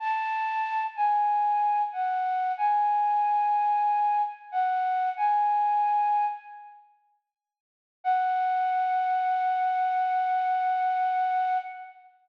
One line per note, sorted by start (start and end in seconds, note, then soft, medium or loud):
0.00 0.83 A5 loud
0.96 1.82 G#5 medium
1.92 2.52 F#5 medium
2.57 4.22 G#5 medium
4.52 5.09 F#5 medium
5.17 6.25 G#5 medium
8.04 11.58 F#5 loud